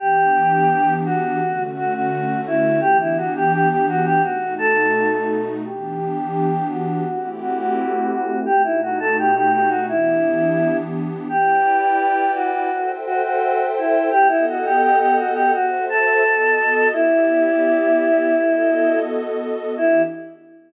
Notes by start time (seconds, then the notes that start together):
0.00 E3 B3 D4 G4
1.05 F#4
1.41 D3 A3 C#4 F#4
1.77 F#4
1.94 F#4
2.47 E4
2.81 E3 B3 D4 G4
3.00 E4
3.17 F#4
3.36 G4
3.53 G4
3.69 G4
3.89 F#4
4.05 G4
4.23 B2 A3 D#4 F#4
4.58 A4
5.65 E3 B3 D4 G4
6.70 F#4
7.07 A3 C4 E4 G4
7.41 F#4
7.59 F#4
8.11 F#4
8.46 B2 A3 D#4 F#4 G4
8.64 E4
8.82 F#4
9.00 A4
9.19 G4
9.35 G4
9.53 G4
9.69 F#4
9.88 E3 B3 D4 E4 G4
11.29 E4 G4 B4 D5 G5
12.35 F#4
12.72 A4 C5 E5 G5
13.06 F#4
13.23 F#4
13.78 E4
14.11 B3 G4 A4 D#5 F#5
14.29 E4
14.49 F#4
14.65 G4
14.82 G4
14.99 G4
15.17 F#4
15.34 G4
15.53 F#4 A4 C5 E5
15.89 A4
16.24 B3 F#4 A4 D#5
16.93 B3 E4 G4 D5 E5
18.35 B3 F#4 A4 D#5
19.77 E3 B3 D4 E4 G4